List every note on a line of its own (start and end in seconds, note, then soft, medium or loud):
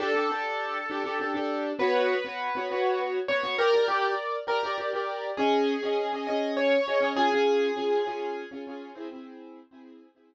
0.00 0.10 D4 loud
0.00 0.10 G4 medium
0.00 1.50 A4 loud
0.15 0.27 D4 medium
0.15 0.27 G4 medium
0.15 0.27 A4 medium
0.29 0.77 D4 medium
0.29 0.77 G4 medium
0.29 0.77 A4 medium
0.90 1.02 D4 medium
0.90 1.02 G4 medium
0.90 1.02 A4 medium
1.04 1.16 D4 medium
1.04 1.16 G4 medium
1.04 1.16 A4 medium
1.20 1.32 D4 medium
1.20 1.32 G4 medium
1.20 1.32 A4 medium
1.34 1.70 D4 medium
1.34 1.70 G4 medium
1.34 1.70 A4 medium
1.79 2.15 B3 medium
1.79 2.15 F#4 medium
1.79 3.00 B4 loud
1.79 2.15 C#5 loud
2.24 2.48 B3 medium
2.24 2.48 F#4 medium
2.24 2.48 C#5 medium
2.55 2.67 B3 medium
2.55 2.67 F#4 medium
2.55 2.67 C#5 medium
2.70 3.18 B3 medium
2.70 3.18 F#4 medium
2.70 3.18 C#5 medium
3.28 3.41 B3 medium
3.28 3.41 F#4 medium
3.28 3.55 C#5 loud
3.43 3.55 B3 medium
3.43 3.55 F#4 medium
3.43 3.55 C#5 medium
3.58 3.71 G4 loud
3.58 3.85 A#4 loud
3.58 3.71 D5 medium
3.73 3.85 G4 medium
3.73 3.85 A#4 medium
3.73 3.85 D5 medium
3.88 4.12 G4 loud
3.88 4.37 A#4 medium
3.88 4.37 D5 medium
4.47 4.59 G4 medium
4.47 4.75 A#4 loud
4.47 4.59 D5 medium
4.63 4.75 G4 medium
4.63 4.75 A#4 medium
4.63 4.75 D5 medium
4.78 4.90 G4 medium
4.78 4.90 A#4 medium
4.78 4.90 D5 medium
4.93 5.29 G4 medium
4.93 5.29 A#4 medium
4.93 5.29 D5 medium
5.37 5.74 C#4 medium
5.37 6.12 G#4 medium
5.37 5.74 D#5 medium
5.83 6.06 C#4 medium
5.83 6.06 G#4 medium
5.83 6.06 D#5 medium
6.13 6.25 C#4 medium
6.13 6.25 G#4 medium
6.13 6.25 D#5 medium
6.27 6.76 C#4 medium
6.27 6.76 G#4 medium
6.27 6.52 D#5 medium
6.57 7.07 C#5 loud
6.86 6.98 C#4 medium
6.86 6.98 G#4 medium
6.86 6.98 D#5 medium
7.00 7.12 C#4 medium
7.00 7.12 G#4 medium
7.00 7.12 D#5 medium
7.16 7.28 C#4 medium
7.16 7.28 F4 medium
7.16 8.47 G#4 loud
7.32 7.68 C#4 medium
7.32 7.68 F4 medium
7.32 7.68 G#4 medium
7.76 8.00 C#4 medium
7.76 8.00 F4 medium
7.76 8.00 G#4 medium
8.06 8.42 C#4 medium
8.06 8.42 F4 medium
8.06 8.42 G#4 medium
8.51 8.63 C#4 medium
8.51 8.63 F4 medium
8.51 8.63 G#4 medium
8.67 8.91 C#4 medium
8.67 8.91 F4 medium
8.67 8.91 G#4 medium
8.95 9.07 C4 medium
8.95 9.07 E4 medium
8.95 9.07 G#4 medium
9.11 9.59 C4 medium
9.11 9.59 E4 medium
9.11 9.59 G#4 medium
9.71 10.07 C4 medium
9.71 10.07 E4 medium
9.71 10.07 G#4 medium
10.15 10.34 C4 medium
10.15 10.34 E4 medium
10.15 10.34 G#4 medium